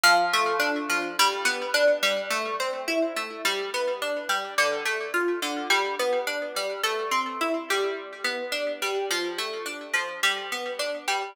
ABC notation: X:1
M:4/4
L:1/8
Q:1/4=106
K:Am
V:1 name="Harpsichord"
F, A, D F, G, B, D G, | A, C E A, G, B, D G, | D, A, F D, G, B, D G, | A, C E G,2 B, D G, |
F, A, D F, G, B, D G, |]